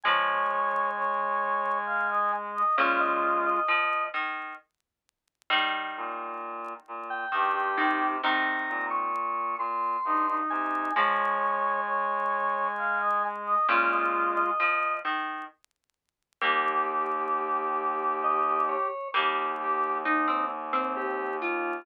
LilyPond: <<
  \new Staff \with { instrumentName = "Lead 1 (square)" } { \time 3/4 \key ees \mixolydian \tempo 4 = 66 aes''2. | f''16 ees''8 ees''8. r4. | r4. r16 g''4~ g''16 | bes''8. des'''8. c'''4 aes''8 |
aes''2. | f''16 ees''8 ees''8. r4. | r2 ees''8 des''8 | r2 g'8 f'8 | }
  \new Staff \with { instrumentName = "Brass Section" } { \time 3/4 \key ees \mixolydian des''4 des''4 f''16 ees''16 r16 ees''16 | f'4 r2 | r2 g'16 g'8. | r2 ees'16 ees'8. |
des''4 des''4 f''16 ees''16 r16 ees''16 | f'4 r2 | g'2. | g'8 g'8 ees'8 r4. | }
  \new Staff \with { instrumentName = "Pizzicato Strings" } { \time 3/4 \key ees \mixolydian <f aes>2 r4 | <bes, des>4 f8 ees8 r4 | <ees g>2 ees8 ees8 | <c ees>4 r2 |
<f aes>2 r4 | <bes, des>4 f8 ees8 r4 | <g bes>2. | <g bes>4 ees'16 c'16 r16 c'8. f'8 | }
  \new Staff \with { instrumentName = "Clarinet" } { \clef bass \time 3/4 \key ees \mixolydian aes2. | aes4 r2 | r8 bes,4 bes,8 g,8 c8 | r8 bes,4 bes,8 g,8 c8 |
aes2. | aes4 r2 | ees,2. | ees,2. | }
>>